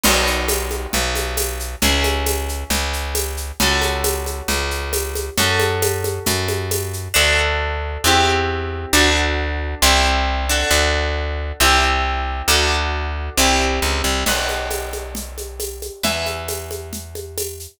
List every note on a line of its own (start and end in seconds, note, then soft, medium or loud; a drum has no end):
0.04 0.87 B1 medium
0.04 1.78 B3 medium
0.04 1.78 D#4 medium
0.04 1.78 F#4 medium
0.04 crash loud
0.04 low conga loud
0.04 shaker medium
0.27 shaker medium
0.48 tambourine medium
0.48 high conga medium
0.48 shaker medium
0.71 high conga medium
0.71 shaker medium
0.93 1.76 B1 medium
0.93 low conga medium
0.93 shaker medium
1.15 high conga medium
1.15 shaker medium
1.37 tambourine medium
1.37 high conga medium
1.37 shaker medium
1.60 shaker medium
1.82 2.64 C#2 medium
1.82 3.56 C#4 medium
1.82 3.56 E4 medium
1.82 3.56 G#4 medium
1.82 low conga loud
1.82 shaker medium
2.04 high conga medium
2.04 shaker medium
2.26 tambourine medium
2.26 high conga medium
2.26 shaker medium
2.49 shaker medium
2.70 3.52 C#2 medium
2.70 low conga medium
2.70 shaker medium
2.93 shaker medium
3.15 tambourine medium
3.15 high conga medium
3.15 shaker medium
3.37 shaker medium
3.60 4.42 C#2 medium
3.60 5.35 C#4 medium
3.60 5.35 F#4 medium
3.60 5.35 A4 medium
3.60 low conga loud
3.60 shaker medium
3.82 high conga medium
3.82 shaker medium
4.04 tambourine medium
4.04 high conga medium
4.04 shaker medium
4.26 high conga medium
4.26 shaker medium
4.48 5.30 C#2 medium
4.48 low conga medium
4.48 shaker medium
4.71 shaker medium
4.93 tambourine medium
4.93 high conga medium
4.93 shaker medium
5.15 high conga medium
5.15 shaker medium
5.37 6.19 F#2 medium
5.37 7.12 C#4 medium
5.37 7.12 F#4 medium
5.37 7.12 A4 medium
5.37 low conga medium
5.37 shaker medium
5.60 high conga medium
5.60 shaker medium
5.82 tambourine medium
5.82 high conga loud
5.82 shaker medium
6.04 high conga medium
6.04 shaker medium
6.26 7.09 F#2 medium
6.26 low conga medium
6.26 shaker medium
6.48 high conga medium
6.48 shaker medium
6.71 tambourine medium
6.71 high conga medium
6.71 shaker medium
6.93 shaker medium
7.14 7.98 D2 medium
7.14 8.01 D4 medium
7.14 8.01 F#4 medium
7.14 8.01 A4 medium
8.04 8.86 E2 medium
8.04 8.92 C4 medium
8.04 8.92 E4 medium
8.04 8.92 G4 medium
8.93 9.75 D2 loud
8.93 9.80 D4 medium
8.93 9.80 F#4 medium
8.93 9.80 A4 medium
9.82 10.64 C2 loud
9.82 10.46 C4 medium
9.82 10.46 E4 medium
9.82 10.46 G4 medium
10.49 11.59 D4 medium
10.49 11.59 F#4 medium
10.49 11.59 A4 medium
10.71 11.52 D2 medium
11.60 12.42 C2 loud
11.60 12.47 C4 medium
11.60 12.47 E4 medium
11.60 12.47 G4 medium
12.48 13.30 D2 loud
12.48 13.36 D4 medium
12.48 13.36 F#4 medium
12.48 13.36 A4 medium
13.37 13.80 C2 loud
13.37 14.25 C4 medium
13.37 14.25 E4 medium
13.37 14.25 G4 medium
13.82 14.02 C#2 medium
14.04 14.24 C2 medium
14.26 15.90 B1 medium
14.26 16.00 B4 medium
14.26 16.00 D#5 medium
14.26 16.00 F#5 medium
14.26 crash medium
14.26 low conga medium
14.26 shaker medium
14.49 high conga medium
14.49 shaker medium
14.71 tambourine medium
14.71 high conga medium
14.71 shaker medium
14.93 high conga medium
14.93 shaker medium
15.15 low conga medium
15.15 shaker medium
15.38 high conga medium
15.38 shaker medium
15.60 tambourine medium
15.60 high conga medium
15.60 shaker medium
15.82 high conga medium
15.82 shaker medium
16.03 17.67 E2 medium
16.03 17.78 B4 medium
16.03 17.78 E5 medium
16.03 17.78 G#5 soft
16.03 low conga medium
16.03 shaker medium
16.26 high conga medium
16.26 shaker medium
16.48 tambourine medium
16.48 high conga medium
16.48 shaker medium
16.71 high conga medium
16.71 shaker medium
16.93 low conga medium
16.93 shaker medium
17.15 high conga medium
17.15 shaker medium
17.38 tambourine medium
17.38 high conga medium
17.38 shaker medium
17.60 shaker medium